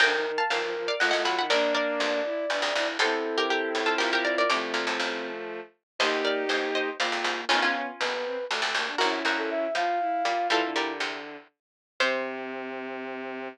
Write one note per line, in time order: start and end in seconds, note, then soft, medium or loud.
0.00 0.32 F1 medium
0.00 0.32 D2 medium
0.00 0.13 D3 medium
0.00 0.43 A#4 medium
0.00 0.34 G5 loud
0.00 0.34 A#5 loud
0.12 0.24 D#3 medium
0.26 0.38 D#3 medium
0.38 0.50 F5 medium
0.38 0.50 A5 medium
0.50 0.95 G1 medium
0.50 0.95 D#2 medium
0.50 0.61 F3 medium
0.50 0.95 A#4 medium
0.50 0.81 F5 medium
0.50 0.81 A5 medium
0.62 0.74 F3 medium
0.76 0.88 F3 medium
0.88 1.00 D5 medium
0.88 1.00 F5 loud
1.00 1.13 F#1 medium
1.00 1.13 F2 medium
1.00 1.12 A3 medium
1.00 1.43 F4 medium
1.00 1.10 D#5 medium
1.00 1.10 F#5 medium
1.11 1.25 A1 medium
1.11 1.25 F#2 medium
1.11 1.24 A3 medium
1.11 1.23 D#5 medium
1.11 1.23 F#5 loud
1.25 1.46 B1 medium
1.25 1.46 A2 medium
1.25 1.36 F#3 medium
1.25 1.37 F#5 medium
1.25 1.37 B5 medium
1.38 1.50 D#3 medium
1.38 1.50 F#5 medium
1.38 1.50 B5 medium
1.50 1.82 A#1 medium
1.50 1.82 G2 medium
1.50 2.21 A#3 medium
1.50 2.21 D4 loud
1.50 1.72 A#4 loud
1.50 2.88 D5 medium
1.50 1.72 D5 loud
1.75 2.35 A#4 medium
1.75 2.35 D5 loud
2.00 2.46 A1 medium
2.00 2.46 F2 medium
2.24 2.45 E4 medium
2.50 2.62 G1 medium
2.50 2.62 E2 medium
2.50 2.70 D4 medium
2.62 2.74 F1 medium
2.62 2.74 D2 medium
2.75 2.98 F1 medium
2.75 2.98 D2 medium
2.75 2.96 E4 medium
2.99 3.71 E2 medium
2.99 3.71 C3 loud
2.99 4.42 C4 medium
2.99 4.42 E4 medium
2.99 3.35 A4 medium
2.99 3.44 A4 medium
2.99 3.35 C5 loud
3.38 3.49 G4 medium
3.38 3.49 A#4 loud
3.50 3.82 G4 medium
3.50 3.92 A4 medium
3.50 3.82 A#4 medium
3.75 3.96 C#2 medium
3.75 3.96 A2 medium
3.86 3.98 F4 medium
3.86 3.98 A4 medium
3.98 4.45 A#1 medium
3.98 4.45 G2 medium
3.98 4.48 F4 medium
3.98 4.10 G4 medium
3.98 4.10 A#4 loud
4.13 4.25 G4 medium
4.13 4.24 A#4 loud
4.25 4.36 A#4 medium
4.25 4.36 D5 medium
4.38 4.50 A#4 medium
4.38 4.50 D5 loud
4.49 4.74 C2 medium
4.49 4.74 A2 medium
4.49 5.60 F3 medium
4.49 5.60 A3 medium
4.49 5.30 C4 medium
4.49 5.10 A#5 medium
4.49 5.10 D6 loud
4.74 4.86 D2 medium
4.74 4.86 A#2 medium
4.87 4.99 C2 medium
4.87 4.99 A2 medium
4.99 5.60 A1 medium
4.99 5.60 F2 medium
5.99 6.32 G1 medium
5.99 6.32 D#2 medium
5.99 6.44 A#3 medium
5.99 6.89 D#4 medium
5.99 6.89 G4 loud
5.99 6.21 C5 medium
5.99 6.21 D#5 medium
6.25 6.48 A#4 medium
6.25 6.48 D5 medium
6.49 6.93 A1 medium
6.49 6.93 F2 medium
6.49 6.90 A#3 medium
6.49 6.69 C5 medium
6.49 6.69 D#5 medium
6.75 6.96 C5 medium
6.75 6.96 D#5 medium
6.99 7.12 G#1 medium
6.99 7.12 F2 medium
6.99 7.45 A#3 medium
6.99 7.40 F4 medium
6.99 7.46 D5 medium
6.99 7.46 F5 medium
7.12 7.24 G#1 medium
7.12 7.24 F2 medium
7.24 7.45 C2 medium
7.24 7.45 G#2 medium
7.49 7.82 G#1 medium
7.49 7.82 F2 medium
7.49 7.91 B3 medium
7.49 7.61 C#4 loud
7.49 7.62 D#4 medium
7.49 7.61 F4 loud
7.62 7.74 C#4 medium
7.62 8.14 C#4 medium
7.62 8.14 F4 medium
7.75 7.87 C#4 medium
8.00 8.47 G1 medium
8.00 8.47 D#2 medium
8.00 8.12 B3 medium
8.00 8.45 B4 medium
8.13 8.24 B3 medium
8.25 8.37 C4 medium
8.50 8.61 F1 medium
8.50 8.61 D2 medium
8.50 8.61 A3 medium
8.62 8.74 F1 medium
8.62 8.74 D2 medium
8.62 8.74 A3 medium
8.74 8.95 F1 medium
8.74 8.95 D2 medium
8.74 8.87 A#3 medium
8.86 8.98 D4 medium
8.98 9.23 A#1 medium
8.98 9.23 F#2 medium
8.98 9.67 C#4 medium
8.98 9.67 E4 medium
8.98 9.19 F#4 medium
8.98 9.19 A#4 medium
9.25 9.67 A#1 medium
9.25 9.67 F#2 medium
9.25 9.91 F#4 medium
9.25 9.91 A#4 medium
9.38 9.50 A4 medium
9.50 9.74 E5 medium
9.75 10.22 A2 medium
9.75 10.22 F3 medium
9.75 9.99 F4 medium
9.75 10.48 F5 medium
10.00 10.23 E4 medium
10.24 10.49 A#2 medium
10.24 10.49 G3 medium
10.24 10.47 F4 medium
10.50 10.70 A#2 medium
10.50 10.62 E3 medium
10.50 10.70 G3 medium
10.50 10.92 E4 medium
10.50 10.74 F4 medium
10.50 10.74 A4 loud
10.62 11.36 D3 medium
10.76 10.99 A#2 medium
10.76 10.99 G3 medium
10.76 11.20 G4 medium
10.76 11.20 A#4 medium
11.00 11.48 E2 medium
11.00 11.48 C3 medium
12.00 13.48 C3 loud
12.00 13.49 C4 loud
12.00 13.48 C5 loud